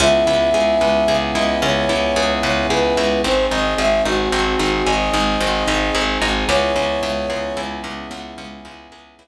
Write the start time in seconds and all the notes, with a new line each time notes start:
0.00 C#2 B3 C#4 E4 G#4 E5
0.27 C#2 E4
0.54 C#2 G#4
0.81 C#2 B4
1.08 C#2 G#4
1.35 C#2 E4 D#5
1.62 C#2 C#4 C#5
1.89 C#2 E4
2.16 C#2 G#4
2.43 C#2 B4 C#5
2.70 C#2 G#4 B4
2.97 C#2 E4
3.24 G#1 C4 D#4 G#4 C5
3.51 G#1 D#4 D#5
3.78 G#1 G#4 E5
4.05 G#1 D#4 F#4
4.32 G#1 C4
4.59 G#1 D#4
4.86 G#1 G#4 D#5
5.14 G#1 D#4
5.41 G#1 C4
5.68 G#1 D#4
5.95 G#1 G#4
6.22 G#1 D#4
6.48 C#2 B3 C#4 E4 G#4 C#5
6.76 C#2 C#4
7.03 C#2 E4
7.30 C#2 G#4
7.57 C#2 E4
7.84 C#2 C#4
8.11 C#2 B3
8.38 C#2 C#4
8.65 C#2 E4
8.92 C#2 G#4
9.19 C#2 E4